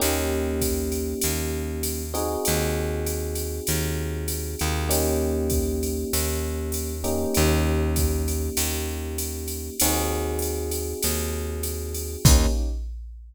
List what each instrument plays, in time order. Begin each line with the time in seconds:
0.00 electric bass (finger) D#2, electric piano 1 A#3 C#4 D#4 G4, ride
0.61 kick, hi-hat pedal, ride
0.92 ride
1.21 electric bass (finger) D#2, ride
1.83 hi-hat pedal, ride
2.14 electric piano 1 C4 D#4 F#4 G#4, ride
2.45 electric bass (finger) D#2, ride
3.07 hi-hat pedal, ride
3.35 ride
3.67 electric bass (finger) D#2, ride
4.28 hi-hat pedal, ride
4.59 electric bass (finger) D#2, ride
4.89 electric piano 1 A#3 C#4 D#4 G4, ride
5.50 kick, hi-hat pedal, ride
5.83 ride
6.13 electric bass (finger) D#2, ride
6.72 hi-hat pedal, ride
7.04 electric piano 1 A#3 C#4 D#4 G4, ride
7.34 electric bass (finger) D#2, ride
7.96 kick, hi-hat pedal, ride
8.28 ride
8.57 electric bass (finger) D#2, ride
9.18 hi-hat pedal, ride
9.48 ride
9.80 electric bass (finger) D#2, electric piano 1 C4 D#4 F#4 G#4, ride
10.39 hi-hat pedal, ride
10.71 ride
11.03 electric bass (finger) D#2, ride
11.63 hi-hat pedal, ride
11.95 ride
12.25 electric bass (finger) D#2, electric piano 1 A#3 C#4 D#4 G4, kick, crash